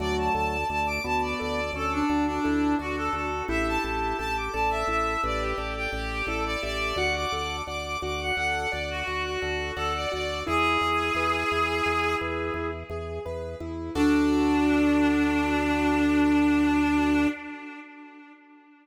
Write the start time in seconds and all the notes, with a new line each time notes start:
0.00 D2 F#3 A3 F#4 D5
0.19 A5
0.35 D2 A4 A5
0.69 D2 A3 D5 A5
0.86 D6
1.04 D2 B3 F#4 A5
1.22 D5
1.40 D2 A4 D5
1.73 D2 C#4 A4 D5
1.92 D4
2.09 D2 D4 F#4
2.26 D4
2.44 D2 E4 A4
2.79 D2 D4 F#4 D5
2.97 A4
3.13 D2 F#4 A4
3.48 A1 E4 G4 E5
3.68 A5
3.84 A1 G4 A5
4.18 A1 G4 A4 A5
4.36 D6
4.53 A1 A4 D5 A5
4.70 E5
4.87 A1 E4 E5
5.23 A1 G4 B4 D5
5.40 G4
5.58 A1 A4 D5
5.76 G4
5.92 A1 D5
6.26 A1 E4 A4 D5
6.45 D5
6.63 A1 G4 D5 E5
6.96 D2 F#4 D5 F#5
7.16 D6
7.32 D2 A4 D6
7.67 D2 D5 F#5 D6
7.85 D6
8.02 D2 F#4 F#5 D6
8.21 F#5
8.36 D2 A4 F#5
8.71 D2 D5 F#5
8.90 F#4
9.07 D2 F#4 F#5
9.23 F#4
9.42 D2 A4 F#5
9.76 D2 A4 D5 F#5
9.95 D5
10.12 D2 F#4 D5 F#5
10.47 E2 E4 G#4
10.81 E2 G#4
11.15 E2 B4
11.51 E2 E4
11.86 E2 G#4
12.21 E2 B4
12.54 E2 E4
12.90 E2 G#4
13.26 E2 B4
13.60 E2 E4
13.95 D2 D4 F#4 A4 D5